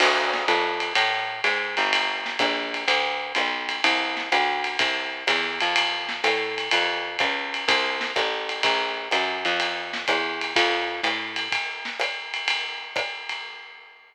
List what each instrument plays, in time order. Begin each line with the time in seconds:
0.00 electric bass (finger) D2, crash, ride
0.34 snare
0.48 electric bass (finger) F2, hi-hat pedal, ride
0.80 ride
0.95 electric bass (finger) A2, ride
1.44 electric bass (finger) G#2, hi-hat pedal, ride
1.77 electric bass (finger) G1, ride
1.93 ride
2.26 snare
2.39 electric bass (finger) A#1, kick, hi-hat pedal, ride
2.74 ride
2.88 electric bass (finger) D2, ride
3.35 electric bass (finger) B1, hi-hat pedal, ride
3.69 ride
3.84 electric bass (finger) C2, ride
4.17 snare
4.32 electric bass (finger) D2, hi-hat pedal, ride
4.64 ride
4.79 electric bass (finger) C2, kick, ride
5.27 electric bass (finger) E2, kick, hi-hat pedal, ride
5.61 electric bass (finger) F2, ride
5.76 ride
6.09 snare
6.24 electric bass (finger) A2, hi-hat pedal, ride
6.58 ride
6.71 electric bass (finger) F2, ride
7.19 electric bass (finger) C#2, kick, hi-hat pedal, ride
7.54 ride
7.68 electric bass (finger) C2, kick, ride
8.01 snare
8.16 electric bass (finger) A1, kick, hi-hat pedal, ride
8.49 ride
8.63 electric bass (finger) A#1, kick, ride
9.11 electric bass (finger) F#2, hi-hat pedal, ride
9.45 electric bass (finger) F2, ride
9.60 ride
9.93 snare
10.08 electric bass (finger) E2, kick, hi-hat pedal, ride
10.41 ride
10.56 electric bass (finger) F2, kick, ride
11.03 electric bass (finger) A2, hi-hat pedal, ride
11.36 ride
11.52 kick, ride
11.85 snare
12.00 hi-hat pedal, ride
12.34 ride
12.48 ride
12.96 kick, hi-hat pedal, ride
13.29 ride